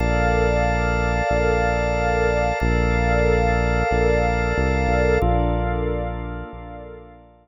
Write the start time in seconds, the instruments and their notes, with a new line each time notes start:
0.00 synth bass 1 A#1, pad 5 (bowed) A4 A#4 D5 F5, drawbar organ A#4 D5 F5 A5
1.31 synth bass 1 A#1
2.60 synth bass 1 A#1, pad 5 (bowed) A4 A#4 D5 F5, drawbar organ A#4 D5 F5 A5
3.91 synth bass 1 A#1
4.58 synth bass 1 C2
4.88 synth bass 1 B1
5.22 synth bass 1 A#1, drawbar organ A#3 D4 F4 A4, pad 5 (bowed) A4 A#4 D5 F5
6.53 synth bass 1 A#1